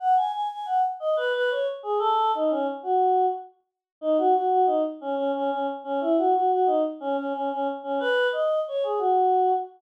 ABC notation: X:1
M:3/4
L:1/16
Q:1/4=90
K:Bmix
V:1 name="Choir Aahs"
f g g g f z d B B c z G | A2 D C z F3 z4 | D F F F D z C C C C z C | E F F F D z C C C C z C |
B2 d2 c G F4 z2 |]